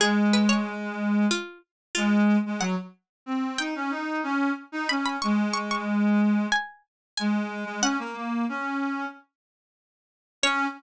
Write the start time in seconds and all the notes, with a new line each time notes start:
0.00 G#3 G#4
0.33 B4
0.49 C#5
1.31 F4
1.95 G#3 F4
2.46 G#3
2.60 F#3 F#5
3.26 C4
3.58 D#4 G5
3.76 C#4
3.91 D#4
4.23 C#4
4.72 D#4
4.89 C#4 B5
5.06 B5
5.22 G#3 C#6
5.54 C#6
5.71 C#6
6.52 G#5
7.17 G#3 G#5
7.65 G#3
7.81 C#4 F#5
7.99 A#3
8.16 A#3
8.49 C#4
10.43 C#4 C#5